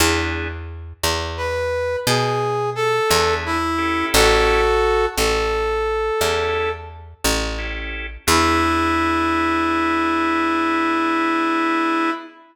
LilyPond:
<<
  \new Staff \with { instrumentName = "Brass Section" } { \time 12/8 \key e \major \tempo 4. = 58 r2 b'4 gis'4 a'4 e'4 | <fis' a'>4. a'2~ a'8 r2 | e'1. | }
  \new Staff \with { instrumentName = "Drawbar Organ" } { \time 12/8 \key e \major <b d' e' gis'>1~ <b d' e' gis'>8 <b d' e' gis'>4 <cis' e' g' a'>8~ | <cis' e' g' a'>2. <cis' e' g' a'>2 <cis' e' g' a'>4 | <b d' e' gis'>1. | }
  \new Staff \with { instrumentName = "Electric Bass (finger)" } { \clef bass \time 12/8 \key e \major e,4. e,4. b,4. e,4. | a,,4. a,,4. e,4. a,,4. | e,1. | }
>>